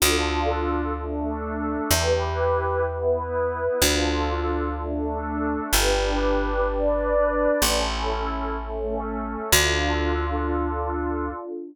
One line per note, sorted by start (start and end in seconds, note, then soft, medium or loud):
0.00 1.77 D2 medium
0.00 0.93 D4 medium
0.00 0.93 F4 medium
0.00 0.93 A4 loud
0.97 1.91 A3 loud
0.97 1.91 D4 loud
0.97 1.91 A4 loud
1.90 3.66 E2 medium
1.90 2.84 E4 medium
1.90 2.84 G4 medium
1.90 2.84 B4 loud
2.85 3.80 B3 loud
2.85 3.80 E4 medium
2.85 3.80 B4 medium
3.80 5.57 D2 medium
3.80 4.74 D4 medium
3.80 4.74 F4 medium
3.80 4.74 A4 medium
4.78 5.72 A3 medium
4.78 5.71 D4 loud
4.78 5.72 A4 loud
5.71 7.48 G1 medium
5.71 6.66 D4 loud
5.71 6.66 G4 medium
5.71 6.66 B4 loud
6.67 7.61 D4 loud
6.67 7.61 B4 loud
6.67 7.61 D5 loud
7.62 9.37 A1 medium
7.62 8.56 C#4 loud
7.62 8.57 E4 medium
7.62 8.56 A4 loud
8.57 9.51 A3 loud
8.57 9.51 C#4 medium
8.57 9.51 A4 medium
9.52 11.30 D2 loud
9.52 11.30 D4 medium
9.52 11.30 F4 loud
9.52 11.30 A4 medium